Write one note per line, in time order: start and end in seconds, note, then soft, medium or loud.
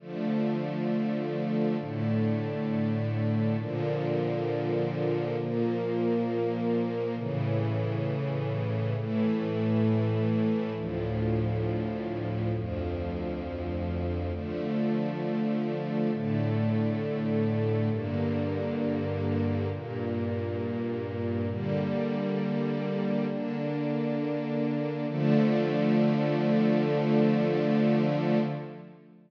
0.00 1.77 D3 medium
0.00 1.77 F3 medium
0.00 1.77 A3 medium
1.79 3.57 A2 medium
1.79 3.57 D3 medium
1.79 3.57 A3 medium
3.58 5.36 A#2 medium
3.58 5.36 D3 medium
3.58 5.36 F3 medium
5.38 7.15 A#2 medium
5.38 7.15 F3 medium
5.38 7.15 A#3 medium
7.17 8.94 A2 medium
7.17 8.94 C#3 medium
7.17 8.94 E3 medium
8.95 10.73 A2 medium
8.95 10.73 E3 medium
8.95 10.73 A3 medium
10.75 12.52 D2 medium
10.75 12.52 A2 medium
10.75 12.52 F3 medium
12.54 14.31 D2 medium
12.54 14.31 F2 medium
12.54 14.31 F3 medium
14.33 16.10 D3 medium
14.33 16.10 F3 medium
14.33 16.10 A3 medium
16.12 17.89 A2 medium
16.12 17.89 D3 medium
16.12 17.89 A3 medium
17.91 19.68 G2 medium
17.91 19.68 D3 medium
17.91 19.68 A#3 medium
19.71 21.48 G2 medium
19.71 21.48 A#2 medium
19.71 21.48 A#3 medium
21.49 23.27 D3 medium
21.49 23.27 G3 medium
21.49 23.27 A#3 medium
23.29 25.06 D3 medium
23.29 25.06 A#3 medium
23.29 25.06 D4 medium
25.08 28.39 D3 loud
25.08 28.39 F3 medium
25.08 28.39 A3 loud